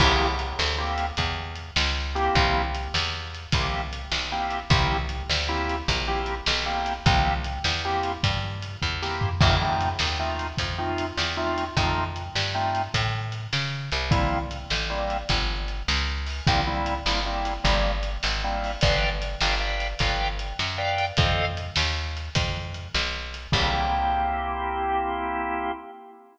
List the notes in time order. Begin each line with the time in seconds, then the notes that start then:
0.00 C2 A#3 C4 E4 G4, kick, crash
0.39 closed hi-hat
0.59 D2, snare
0.78 A#3 C4 E4 G4
0.98 closed hi-hat
1.17 E2, kick, closed hi-hat
1.56 closed hi-hat
1.76 C#2, snare
2.15 A#3 C4 E4 G4, closed hi-hat
2.35 C2, kick, closed hi-hat
2.75 closed hi-hat
2.94 E2, snare
3.35 closed hi-hat
3.52 C2 A#3 C4 E4 G4, kick, closed hi-hat
3.93 closed hi-hat
4.12 B1, snare
4.32 A#3 C4 E4 G4
4.50 closed hi-hat
4.70 C2 A#3 C4 E4 G4, kick, closed hi-hat
5.09 closed hi-hat
5.29 D2, snare
5.48 A#3 C4 E4 G4
5.69 closed hi-hat
5.88 A#1, kick, closed hi-hat
6.08 A#3 C4 E4 G4
6.26 closed hi-hat
6.46 B1, snare
6.66 A#3 C4 E4 G4
6.86 closed hi-hat
7.06 C2 A#3 C4 E4 G4, kick, closed hi-hat
7.44 closed hi-hat
7.64 E2, snare
7.85 A#3 C4 E4 G4
8.03 closed hi-hat
8.23 G2, kick, closed hi-hat
8.62 closed hi-hat
8.82 E2, kick
9.02 A#3 C4 E4 G4, snare
9.21 floor tom
9.41 F2 A3 C4 D#4 F4, kick, crash
9.62 A3 C4 D#4 F4
9.81 closed hi-hat
9.99 D#2, snare
10.19 A3 C4 D#4 F4
10.39 closed hi-hat
10.58 F2, kick, closed hi-hat
10.78 A3 C4 D#4 F4
10.98 closed hi-hat
11.17 E2, snare
11.37 A3 C4 D#4 F4
11.58 closed hi-hat
11.76 F2 A3 C4 D#4 F4, kick, closed hi-hat
12.16 closed hi-hat
12.35 G2, snare
12.55 A3 C4 D#4 F4
12.75 closed hi-hat
12.94 A2, kick, closed hi-hat
13.32 closed hi-hat
13.53 C#3, snare
13.92 C2, closed hi-hat
14.11 G3 A#3 C4 E4, kick, closed hi-hat
14.51 closed hi-hat
14.70 A1, snare
14.90 G3 A#3 C4 E4
15.10 closed hi-hat
15.29 G1, kick, closed hi-hat
15.68 closed hi-hat
15.88 C#2, snare
16.26 open hi-hat
16.47 C2 G3 A#3 C4 E4, kick, closed hi-hat
16.67 G3 A#3 C4 E4
16.86 closed hi-hat
17.06 G1 G3 A#3 C4 E4, snare
17.26 G3 A#3 C4 E4
17.45 closed hi-hat
17.64 G1 G3 A#3 C4 E4, kick, closed hi-hat
18.03 closed hi-hat
18.23 G#1, snare
18.44 G3 A#3 C4 E4
18.64 open hi-hat
18.81 G1 B4 D5 F5 G5, kick, closed hi-hat
19.22 closed hi-hat
19.41 G1 B4 D5 F5 G5, snare
19.60 B4 D5 F5 G5
19.80 closed hi-hat
19.99 G1 B4 D5 F5 G5, kick, closed hi-hat
20.39 closed hi-hat
20.59 F#2, snare
20.78 B4 D5 F5 G5
20.98 closed hi-hat
21.17 F2 A4 C5 D#5 F5, kick, closed hi-hat
21.57 closed hi-hat
21.76 D#2, snare
22.17 closed hi-hat
22.35 F2, kick, closed hi-hat
22.74 closed hi-hat
22.94 B1, snare
23.34 closed hi-hat
23.52 C2 A#3 C4 E4 G4, kick, crash